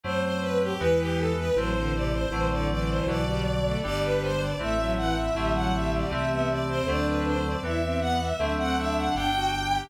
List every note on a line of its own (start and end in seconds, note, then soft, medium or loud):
0.03 0.74 F#2 medium
0.03 0.72 F#3 medium
0.03 0.72 A3 loud
0.03 0.72 C4 loud
0.03 0.22 C5 loud
0.23 0.41 C5 loud
0.41 0.59 B4 loud
0.61 0.79 G4 loud
0.80 1.51 E2 loud
0.80 1.48 E3 loud
0.80 1.32 E3 medium
0.80 1.48 G#3 loud
0.80 1.48 B3 loud
0.80 0.98 B4 loud
0.99 1.17 G4 loud
1.17 1.35 A4 loud
1.38 1.56 B4 loud
1.56 2.26 A1 loud
1.56 2.25 E3 medium
1.56 1.74 F#3 medium
1.56 2.25 A3 medium
1.56 2.25 C4 loud
1.56 1.92 C5 loud
1.75 1.93 D3 medium
1.94 2.12 C3 medium
1.94 2.12 D5 loud
2.12 2.48 C5 loud
2.31 3.01 A1 loud
2.31 3.00 D3 loud
2.31 2.49 E3 medium
2.31 3.00 F#3 loud
2.31 3.00 A3 loud
2.31 3.00 C4 loud
2.50 2.69 D3 medium
2.50 2.69 D5 loud
2.69 3.23 E3 medium
2.69 2.88 D5 loud
2.88 3.06 C5 loud
3.07 3.77 B1 loud
3.07 3.75 D3 loud
3.07 3.75 F#3 medium
3.07 3.75 B3 medium
3.07 3.77 D5 loud
3.26 3.44 G3 medium
3.65 3.83 A3 medium
3.83 4.55 G1 loud
3.83 4.51 D3 loud
3.83 4.51 G3 loud
3.83 4.33 G3 medium
3.83 4.51 B3 loud
3.83 4.01 D5 loud
4.03 4.21 B4 loud
4.22 4.40 C5 loud
4.40 4.58 D5 loud
4.59 5.31 A1 medium
4.59 5.27 E3 loud
4.59 5.27 A3 medium
4.59 4.77 A3 medium
4.59 5.27 C4 loud
4.59 4.90 E5 loud
4.78 4.96 F#3 medium
4.97 5.15 E3 medium
4.97 5.15 F#5 loud
5.16 5.53 E5 loud
5.35 6.05 A1 loud
5.35 6.04 D3 loud
5.35 6.04 F#3 loud
5.35 5.53 G3 medium
5.35 6.04 A3 loud
5.35 6.04 C4 loud
5.54 5.72 F#3 medium
5.54 5.72 F#5 medium
5.73 6.26 G3 medium
5.73 5.91 E5 loud
5.93 6.11 D5 medium
6.10 6.81 C2 loud
6.10 6.79 E3 loud
6.10 6.79 A3 loud
6.10 6.79 C4 loud
6.10 6.30 E5 medium
6.30 6.48 B3 medium
6.30 6.48 E5 medium
6.50 6.68 D5 loud
6.68 6.86 C4 medium
6.68 6.86 C5 loud
6.87 7.56 D2 loud
6.87 7.56 D3 loud
6.87 7.56 F#3 loud
6.87 7.56 A3 loud
6.87 7.56 C4 loud
6.87 7.37 D4 loud
6.87 7.06 D5 loud
7.06 7.24 B4 medium
7.26 7.44 C5 loud
7.45 7.63 D5 medium
7.63 8.33 E2 loud
7.63 8.31 E3 loud
7.63 8.31 G3 medium
7.63 8.31 B3 loud
7.63 7.81 E4 medium
7.63 7.99 E5 loud
7.82 8.00 C4 medium
8.00 8.19 B3 medium
8.00 8.18 F#5 loud
8.20 8.53 E5 loud
8.39 9.09 D2 medium
8.39 9.08 D3 loud
8.39 9.08 F#3 loud
8.39 9.08 A3 loud
8.39 9.08 C4 loud
8.39 8.57 D4 medium
8.58 8.76 C4 medium
8.58 8.76 F#5 loud
8.77 9.31 D4 medium
8.77 8.96 E5 loud
8.97 9.15 F#5 medium
9.15 9.85 G1 loud
9.15 9.84 D3 loud
9.15 9.84 G3 loud
9.15 9.84 B3 loud
9.15 9.80 G5 loud
9.34 9.52 F#4 medium
9.72 9.90 G4 medium